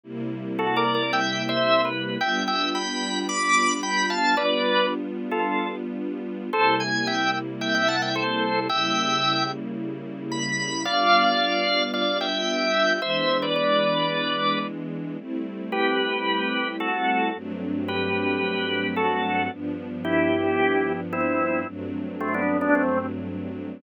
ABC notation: X:1
M:4/4
L:1/16
Q:1/4=111
K:G
V:1 name="Drawbar Organ"
z4 (3[FA]2 [_Bd]2 [Bd]2 (3[eg]4 [ce]4 =B4 | [eg]2 [eg]2 [gb]4 [bd']4 [gb]2 [=fa]2 | [Bd]4 z3 [=FA]3 z6 | [Ac]2 _a2 [eg]2 z2 [eg] [eg] [f=a] [eg] [Ac]4 |
[eg]6 z6 b4 | [d=f]8 [df]2 [eg]6 | [ce]3 [Bd] [Bd]8 z4 | z4 [GB]8 [FA]4 |
z4 [GB]8 [FA]4 | z4 [EG]8 [CE]4 | z4 [A,C] [B,D]2 [B,D] [A,C]2 z6 |]
V:2 name="String Ensemble 1"
[C,G,_B,E]16 | [G,B,D=F]16 | [G,B,D=F]16 | [C,G,_B,E]16 |
[^C,G,_B,E]16 | [G,B,D=F]16 | [E,^G,B,D]16 | [G,A,CE]16 |
[G,,F,A,CD]16 | [G,,=F,B,D]16 | [G,,F,A,CD]16 |]